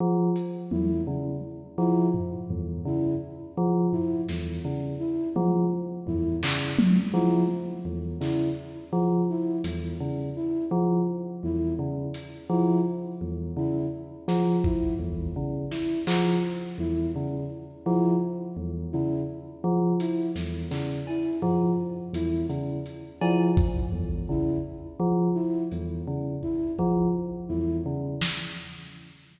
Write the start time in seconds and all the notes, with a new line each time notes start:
0.00 F3
0.36 closed hi-hat
0.71 E2 E4, high tom
1.07 C#3
1.78 F3 E4
2.14 floor tom
2.50 E2, floor tom
2.85 C#3 E4
3.57 F3
3.92 E4, floor tom
4.29 E2, snare
4.65 C#3
5.00 E4
5.36 F3, high tom
6.07 E2 E4, floor tom
6.43 C#3, clap
6.79 high tom
7.14 F3 E4
7.85 E2
8.20 C#3 E4, clap
8.93 F3
9.30 E4
9.64 E2, closed hi-hat
10.00 C#3
10.36 E4
10.71 F3
11.43 E2 E4
11.79 C#3
12.14 closed hi-hat
12.50 F3 E4
13.21 E2
13.57 C#3 E4
14.28 F3, snare
14.64 E4, kick
14.99 E2
15.36 C#3
15.71 E4, snare
16.07 F3, clap
16.78 E2 E4
17.16 C#3
17.86 F3 E4
18.57 E2
18.92 C#3 E4
19.64 F3
20.00 E4, closed hi-hat
20.36 E2, snare
20.71 C#3, clap
21.07 E4, cowbell
21.42 F3, floor tom
22.13 E2 E4, closed hi-hat
22.50 C#3, closed hi-hat
22.86 closed hi-hat
23.21 F3 E4, cowbell
23.57 kick
23.92 E2
24.29 C#3 E4
25.00 F3
25.35 E4
25.71 E2, closed hi-hat
26.07 C#3
26.43 E4, kick
26.79 F3, kick
27.49 E2 E4
27.86 C#3
28.21 snare